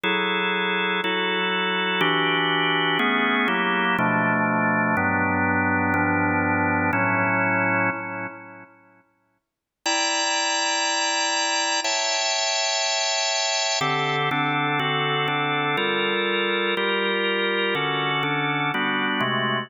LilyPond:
\new Staff { \time 4/4 \key b \mixolydian \tempo 4 = 122 <fis e' gis' a'>2 <fis e' fis' a'>2 | \key a \mixolydian <e d' fis' g'>2 <a b cis' gis'>4 <fis ais e' g'>4 | <b, f a d'>2 <g, fis b d'>2 | <g, f b d'>2 <a, fis cis' e'>2 |
r1 | \key c \mixolydian <e' d'' g'' bes''>1 | <cis'' e'' g'' a''>1 | <d c' g' a'>4 <d c' d' a'>4 <d c' fis' a'>4 <d c' d' a'>4 |
<g f' a' bes'>2 <g f' g' bes'>2 | \key a \mixolydian <d cis' fis' a'>4 <d cis' d' a'>4 <g b d' fis'>4 <bis, gis a fis'>4 | }